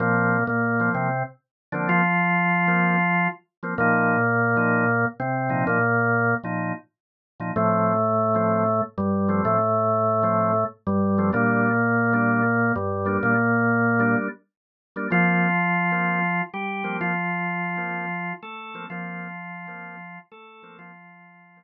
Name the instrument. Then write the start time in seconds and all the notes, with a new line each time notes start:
drawbar organ
0.00 A#2 F3 A#3 C4
0.47 A#2 A#3
0.80 F3 A#3 C4
0.94 C3 C4
1.72 D3 F3 A#3 C4 D4
1.89 F3 F4
2.67 F3 A#3 C4
3.63 F3 A#3 C4
3.78 A#2 F3 A#3 D#4
4.56 A#2 F3 D#4
5.20 C3 C4
5.49 A#2 F3 D#4
5.67 A#2 A#3
6.44 A#2 F3 D#4
7.40 A#2 F3 D#4
7.56 A2 F3 A3 C4
8.34 F3 A3 C4
8.98 G2 G3
9.28 F3 A3 C4
9.45 A2 A3
10.23 F3 A3 C4
10.87 G2 G3
11.18 F3 A3 C4
11.32 A#2 G3 A#3 D4
12.13 G3 A#3 D4
12.76 G2 G3
13.05 G3 A#3 D4
13.23 A#2 A#3
13.99 G3 A#3 D4
14.96 G3 A#3 D4
15.11 F3 A#3 C4 F4
15.91 F3 A#3 C4
16.54 G3 G4
16.83 F3 A#3 C4
17.01 F3 F4
17.77 F3 A#3 C4
18.43 A3 A4
18.74 F3 A#3 C4
18.90 F3 A#3 C4 F4
19.67 F3 A#3 C4
20.31 A3 A4
20.62 F3 A#3 C4
20.79 F3 F4
21.56 F3 A#3 C4